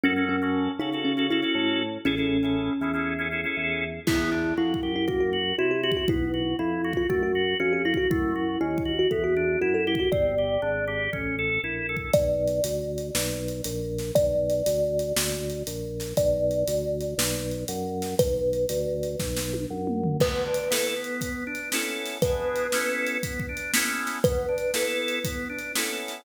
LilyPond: <<
  \new Staff \with { instrumentName = "Kalimba" } { \time 4/4 \key fis \dorian \tempo 4 = 119 cis'8 cis'4 dis'8 cis'8 e'4 r8 | cis'2~ cis'8 r4. | \key e \dorian e'4 e'8. e'16 fis'16 fis'8. fis'16 g'16 g'16 fis'16 | e'4 e'8. eis'16 fis'16 fis'8. fis'16 g'16 e'16 fis'16 |
e'4 e'8. fis'16 a'16 fis'8. fis'16 a'16 e'16 fis'16 | d''2~ d''8 r4. | \key b \dorian d''1 | d''1 |
d''1 | b'2~ b'8 r4. | b'1 | b'1 |
b'1 | }
  \new Staff \with { instrumentName = "Drawbar Organ" } { \time 4/4 \key fis \dorian <cis' fis' a'>16 <cis' fis' a'>8 <cis' fis' a'>8. <cis' fis' a'>16 <cis' fis' a'>8 <cis' fis' a'>16 <cis' fis' a'>16 <cis' fis' a'>4~ <cis' fis' a'>16 | <cis' e' gis' a'>16 <cis' e' gis' a'>8 <cis' e' gis' a'>8. <cis' e' gis' a'>16 <cis' e' gis' a'>8 <cis' e' gis' a'>16 <cis' e' gis' a'>16 <cis' e' gis' a'>4~ <cis' e' gis' a'>16 | \key e \dorian b8 d'8 fis'8 g'8 ais8 fis'8 e'8 fis'8 | b8 fis'8 e'8 fis'8 a8 fis'8 cis'8 fis'8 |
a8 fis'8 cis'8 fis'8 b8 d'8 e'8 g'8 | c'8 g'8 d'8 g'8 cis'8 a'8 e'8 a'8 | \key b \dorian r1 | r1 |
r1 | r1 | b8 d'8 <b e' a'>8 b4 d'8 <b cis' e' a'>4 | <b d' e' gis'>4 <b cis' e' a'>4 b8 d'8 <b cis' e' a'>4 |
b8 d'8 <b e' a'>4 b8 d'8 <b cis' e' a'>4 | }
  \new Staff \with { instrumentName = "Drawbar Organ" } { \clef bass \time 4/4 \key fis \dorian fis,4. cis4. a,4 | a,,4. e,4. e,4 | \key e \dorian e,4 f,8 fis,4. c4 | b,,4 f,4 fis,4 f,4 |
fis,4 dis,4 e,4 fis,4 | g,,4 gis,,4 a,,4 ais,,4 | \key b \dorian b,,4 d,4 b,,4 ais,,4 | b,,4 d,4 d,4 ais,,4 |
b,,4 d,4 b,,4 fis,4 | b,,4 d,4 b,,4 fis,4 | r1 | r1 |
r1 | }
  \new DrumStaff \with { instrumentName = "Drums" } \drummode { \time 4/4 r4 r4 r4 r4 | r4 r4 r4 r4 | <cymc bd>4 \tuplet 3/2 { r8 bd8 r8 } bd4 \tuplet 3/2 { r8 r8 bd8 } | bd4 \tuplet 3/2 { r8 r8 bd8 } bd4 \tuplet 3/2 { r8 r8 bd8 } |
bd4 \tuplet 3/2 { r8 bd8 r8 } bd4 \tuplet 3/2 { r8 r8 bd8 } | bd4 r4 bd4 \tuplet 3/2 { r8 r8 bd8 } | \tuplet 3/2 { <hh bd>8 r8 hh8 hh8 r8 hh8 sn8 r8 hh8 hh8 r8 <hh sn>8 } | \tuplet 3/2 { <hh bd>8 r8 hh8 hh8 r8 hh8 sn8 r8 hh8 hh8 r8 <hh sn>8 } |
\tuplet 3/2 { <hh bd>8 r8 hh8 hh8 r8 hh8 sn8 r8 hh8 hh8 r8 <hh sn>8 } | \tuplet 3/2 { <hh bd>8 r8 hh8 hh8 r8 hh8 <bd sn>8 sn8 tommh8 r8 toml8 tomfh8 } | \tuplet 3/2 { <cymc bd>8 r8 hh8 sn8 r8 hh8 <hh bd>8 r8 hh8 sn8 r8 <hh sn>8 } | \tuplet 3/2 { <hh bd>8 r8 hh8 sn8 r8 hh8 <hh bd>8 bd8 hh8 sn8 r8 <hh sn>8 } |
\tuplet 3/2 { <hh bd>8 r8 hh8 sn8 r8 hh8 <hh bd>8 r8 hh8 sn8 r8 <hh sn>8 } | }
>>